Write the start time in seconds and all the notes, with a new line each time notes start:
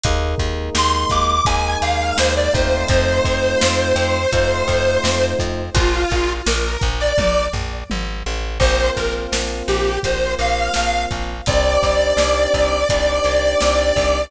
0.03 D#2 G#3 A#3 D#4, kick, closed hi-hat
0.38 D#2, kick, closed hi-hat
0.75 D#2 C6, snare
0.93 C6
1.10 D#2 D6, kick, closed hi-hat
1.28 D6
1.45 D#2 G#3 A#3 D#4 G#5, kick, closed hi-hat
1.82 D#2 F5, closed hi-hat
2.17 D#2 C5, snare
2.36 D5
2.53 D#2 A3 C4 D#4 F4 C5, kick, closed hi-hat
2.88 F2 C5, kick, closed hi-hat
3.25 F2, kick, closed hi-hat
3.61 F2, snare
3.96 F2, closed hi-hat
4.32 F2 A3 C4 D#4 F4, kick, closed hi-hat
4.68 F2, kick, closed hi-hat
5.04 F2, snare
5.39 F2, kick, closed hi-hat
5.75 A#1 F4, kick, closed hi-hat
6.10 A#1, kick, closed hi-hat
6.46 A#1 A#4, snare
6.81 A#1, kick, closed hi-hat
7.00 D5
7.18 A#1, kick, high tom
7.53 A#1, floor tom
7.90 G#1, high tom
8.26 A1
8.60 A#1 A#3 C4 F4 C5, kick, crash
8.97 A#1 A#4, kick, closed hi-hat
9.32 A#1, snare
9.68 A#1 G4, closed hi-hat
10.03 A#1 A#3 C4 F4 C5, kick, closed hi-hat
10.39 A#1 F5, closed hi-hat
10.74 A#1, snare
11.11 A#1, kick, closed hi-hat
11.46 C2 C4 D4 D#4 G4 D5, kick, closed hi-hat
11.83 C2, kick, closed hi-hat
12.17 C2, snare
12.54 C2, kick, closed hi-hat
12.89 C2 C4 D4 D#4 G4, kick, closed hi-hat
13.24 C2, closed hi-hat
13.61 C2, snare
13.96 C2, kick, open hi-hat